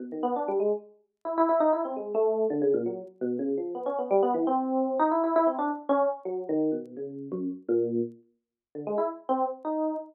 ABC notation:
X:1
M:7/8
L:1/8
Q:1/4=168
K:none
V:1 name="Electric Piano 1"
(3B,, _E, B, (3D G, _A, z3 | (3E E E (3_E =E C _A, =A,2 | (3D, _D, _B,, _G, z =B,, D, F, | (3B, _D B, (3G, B, E, C3 |
(3_E =E E (3E C D z _D z | (3_G,2 _E,2 B,,2 _D,2 _G,, | z _B,,2 z4 | (3D, _A, E z C z _E2 |]